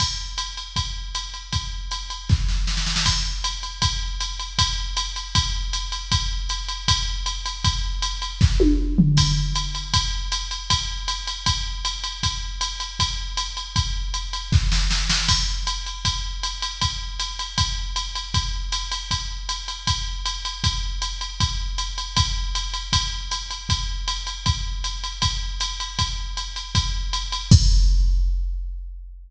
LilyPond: \new DrumStaff \drummode { \time 4/4 \tempo 4 = 157 <cymc bd cymr>4 <hhp cymr>8 cymr8 <bd cymr>4 <hhp cymr>8 cymr8 | <bd cymr>4 <hhp cymr>8 cymr8 <bd sn>8 sn8 sn16 sn16 sn16 sn16 | <cymc bd cymr>4 <hhp cymr>8 cymr8 <bd cymr>4 <hhp cymr>8 cymr8 | <bd cymr>4 <hhp cymr>8 cymr8 <bd cymr>4 <hhp cymr>8 cymr8 |
<bd cymr>4 <hhp cymr>8 cymr8 <bd cymr>4 <hhp cymr>8 cymr8 | <bd cymr>4 <hhp cymr>8 cymr8 <bd sn>8 tommh8 r8 tomfh8 | <cymc bd cymr>4 <hhp cymr>8 cymr8 <bd cymr>4 <hhp cymr>8 cymr8 | <bd cymr>4 <hhp cymr>8 cymr8 <bd cymr>4 <hhp cymr>8 cymr8 |
<bd cymr>4 <hhp cymr>8 cymr8 <bd cymr>4 <hhp cymr>8 cymr8 | <bd cymr>4 <hhp cymr>8 cymr8 <bd sn>8 sn8 sn8 sn8 | <cymc bd cymr>4 <hhp cymr>8 cymr8 <bd cymr>4 <hhp cymr>8 cymr8 | <bd cymr>4 <hhp cymr>8 cymr8 <bd cymr>4 <hhp cymr>8 cymr8 |
<bd cymr>4 <hhp cymr>8 cymr8 <bd cymr>4 <hhp cymr>8 cymr8 | <bd cymr>4 <hhp cymr>8 cymr8 <bd cymr>4 <hhp cymr>8 cymr8 | <bd cymr>4 <hhp cymr>8 cymr8 <bd cymr>4 <hhp cymr>8 cymr8 | <bd cymr>4 <hhp cymr>8 cymr8 <bd cymr>4 <hhp cymr>8 cymr8 |
<bd cymr>4 <hhp cymr>8 cymr8 <bd cymr>4 <hhp cymr>8 cymr8 | <bd cymr>4 <hhp cymr>8 cymr8 <bd cymr>4 <hhp cymr>8 cymr8 | <cymc bd>4 r4 r4 r4 | }